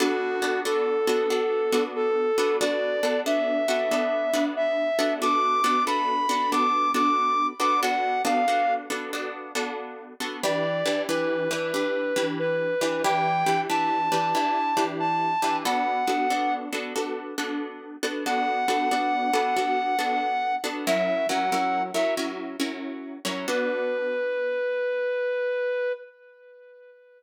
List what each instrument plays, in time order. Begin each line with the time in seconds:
0.00 acoustic guitar (steel) B3 D4 F#4 A4, brass section F#4
0.42 acoustic guitar (steel) B3 D4 F#4 A4
0.65 acoustic guitar (steel) B3 D4 F#4 A4, brass section A4
1.07 acoustic guitar (steel) B3 D4 F#4 A4
1.30 acoustic guitar (steel) B3 D4 F#4 A4
1.72 acoustic guitar (steel) B3 D4 F#4 A4
1.96 brass section A4
2.38 acoustic guitar (steel) B3 D4 F#4 A4
2.61 acoustic guitar (steel) B3 D4 F#4 A4, brass section D5
3.03 acoustic guitar (steel) B3 D4 F#4 A4
3.26 acoustic guitar (steel) B3 D4 F#4 A4, brass section E5
3.68 acoustic guitar (steel) B3 D4 F#4 A4
3.91 acoustic guitar (steel) B3 D4 F#4 A4
4.33 acoustic guitar (steel) B3 D4 F#4 A4
4.57 brass section E5
4.99 acoustic guitar (steel) B3 D4 F#4 A4
5.22 acoustic guitar (steel) B3 D4 F#4 A4, brass section D6
5.64 acoustic guitar (steel) B3 D4 F#4 A4
5.87 acoustic guitar (steel) B3 D4 F#4 A4, brass section B5
6.29 acoustic guitar (steel) B3 D4 F#4 A4
6.52 acoustic guitar (steel) B3 D4 F#4 A4, brass section D6
6.94 acoustic guitar (steel) B3 D4 F#4 A4, brass section D6
7.60 acoustic guitar (steel) B3 D4 F#4 A4, brass section D6
7.83 acoustic guitar (steel) B3 D4 F#4 A4, brass section F#5
8.25 acoustic guitar (steel) B3 D4 F#4 A4, brass section F5
8.48 acoustic guitar (steel) B3 D4 F#4 A4
8.90 acoustic guitar (steel) B3 D4 F#4 A4
9.13 acoustic guitar (steel) B3 D4 F#4 A4
9.55 acoustic guitar (steel) B3 D4 F#4 A4
10.20 acoustic guitar (steel) B3 D4 F#4 A4
10.43 acoustic guitar (steel) E3 D4 G4 B4, brass section D5
10.86 acoustic guitar (steel) E3 D4 G4 B4
11.09 acoustic guitar (steel) E3 D4 G4 B4, brass section B4
11.51 acoustic guitar (steel) E3 D4 G4 B4
11.74 acoustic guitar (steel) E3 D4 G4 B4
12.16 acoustic guitar (steel) E3 D4 G4 B4
12.39 brass section B4
12.81 acoustic guitar (steel) E3 D4 G4 B4
13.04 acoustic guitar (steel) E3 D4 G4 B4, brass section G5
13.46 acoustic guitar (steel) E3 D4 G4 B4
13.69 acoustic guitar (steel) E3 D4 G4 B4, brass section A5
14.12 acoustic guitar (steel) E3 D4 G4 B4
14.35 acoustic guitar (steel) E3 D4 G4 B4
14.77 acoustic guitar (steel) E3 D4 G4 B4
15.00 brass section A5
15.42 acoustic guitar (steel) E3 D4 G4 B4
15.65 acoustic guitar (steel) B3 D4 F#4 A4, brass section F#5
16.07 acoustic guitar (steel) B3 D4 F#4 A4
16.30 acoustic guitar (steel) B3 D4 F#4 A4
16.73 acoustic guitar (steel) B3 D4 F#4 A4
16.96 acoustic guitar (steel) B3 D4 F#4 A4
17.38 acoustic guitar (steel) B3 D4 F#4 A4
18.03 acoustic guitar (steel) B3 D4 F#4 A4
18.26 acoustic guitar (steel) B3 D4 F#4 A4, brass section F#5
18.68 acoustic guitar (steel) B3 D4 F#4 A4
18.91 acoustic guitar (steel) B3 D4 F#4 A4
19.33 acoustic guitar (steel) B3 D4 F#4 A4
19.57 acoustic guitar (steel) B3 D4 F#4 A4
19.99 acoustic guitar (steel) B3 D4 F#4 A4
20.64 acoustic guitar (steel) B3 D4 F#4 A4
20.87 acoustic guitar (steel) F#3 C#4 E4 A#4, brass section E5
21.29 acoustic guitar (steel) F#3 C#4 E4 A#4, brass section F#5
21.52 acoustic guitar (steel) F#3 C#4 E4 A#4
21.94 acoustic guitar (steel) F#3 C#4 E4 A#4, brass section E5
22.17 acoustic guitar (steel) F#3 C#4 E4 A#4
22.60 acoustic guitar (steel) F#3 C#4 E4 A#4
23.25 acoustic guitar (steel) F#3 C#4 E4 A#4
23.48 acoustic guitar (steel) B3 D4 F#4 A4, brass section B4